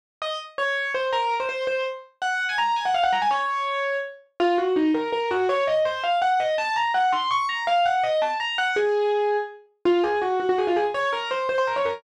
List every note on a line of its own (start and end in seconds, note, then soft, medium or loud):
0.22 0.37 D#5 medium
0.58 0.91 C#5 medium
0.94 1.11 C5 medium
1.12 1.34 A#4 medium
1.40 1.48 C5 medium
1.49 1.64 C5 medium
1.67 1.83 C5 medium
2.22 2.46 F#5 medium
2.49 2.58 G#5 medium
2.58 2.75 A#5 medium
2.76 2.85 G#5 medium
2.85 2.94 F#5 medium
2.94 3.03 F5 medium
3.03 3.12 F#5 medium
3.12 3.21 A#5 medium
3.22 3.30 G#5 medium
3.31 3.97 C#5 medium
4.40 4.57 F4 loud
4.58 4.74 F#4 medium
4.76 4.91 D#4 medium
4.94 5.10 A#4 medium
5.12 5.29 A#4 medium
5.31 5.46 F#4 medium
5.49 5.64 C#5 loud
5.67 5.83 D#5 medium
5.85 6.02 C5 medium
6.04 6.18 F5 medium
6.22 6.39 F#5 medium
6.40 6.55 D#5 medium
6.58 6.76 A5 loud
6.76 6.92 A#5 medium
6.94 7.12 F#5 medium
7.12 7.29 C6 medium
7.31 7.46 C#6 medium
7.49 7.65 A#5 medium
7.67 7.85 F5 medium
7.85 8.02 F#5 medium
8.03 8.21 D#5 medium
8.22 8.37 A5 medium
8.40 8.57 A#5 medium
8.58 8.76 F#5 medium
8.76 9.37 G#4 medium
9.85 10.01 F4 loud
10.03 10.19 G#4 medium
10.22 10.38 F#4 medium
10.40 10.48 F#4 medium
10.49 10.58 F#4 medium
10.58 10.67 G#4 medium
10.67 10.76 F4 medium
10.76 10.85 G#4 medium
10.94 11.09 C#5 medium
11.13 11.29 A#4 medium
11.31 11.48 C5 medium
11.49 11.57 C5 medium
11.58 11.67 C5 medium
11.67 11.76 A#4 medium
11.76 11.85 C#5 medium
11.85 11.94 A#4 medium